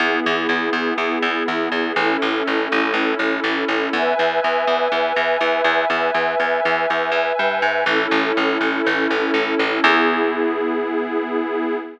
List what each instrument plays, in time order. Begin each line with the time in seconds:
0.00 electric bass (finger) E2, pad 5 (bowed) B3 E4 G#4
0.26 electric bass (finger) E2
0.49 electric bass (finger) E2
0.73 electric bass (finger) E2
0.98 electric bass (finger) E2
1.22 electric bass (finger) E2
1.48 electric bass (finger) E2
1.72 electric bass (finger) E2
1.96 electric bass (finger) A1, pad 5 (bowed) C#4 E4 A4
2.22 electric bass (finger) A1
2.47 electric bass (finger) A1
2.72 electric bass (finger) A1
2.94 electric bass (finger) A1
3.19 electric bass (finger) A1
3.44 electric bass (finger) A1
3.68 electric bass (finger) A1
3.93 electric bass (finger) E2, pad 5 (bowed) B4 E5 G#5
4.19 electric bass (finger) E2
4.44 electric bass (finger) E2
4.67 electric bass (finger) E2
4.92 electric bass (finger) E2
5.16 electric bass (finger) E2
5.41 electric bass (finger) E2
5.64 electric bass (finger) E2
5.90 electric bass (finger) E2, pad 5 (bowed) B4 E5 G#5
6.14 electric bass (finger) E2
6.40 electric bass (finger) E2
6.65 electric bass (finger) E2
6.90 electric bass (finger) E2
7.12 electric bass (finger) E2
7.39 electric bass (finger) G2
7.62 electric bass (finger) G#2
7.86 electric bass (finger) A1, pad 5 (bowed) C#4 E4 A4
8.11 electric bass (finger) A1
8.37 electric bass (finger) A1
8.61 electric bass (finger) A1
8.86 electric bass (finger) A1
9.11 electric bass (finger) A1
9.34 electric bass (finger) A1
9.59 electric bass (finger) A1
9.83 electric bass (finger) E2, pad 5 (bowed) B3 E4 G#4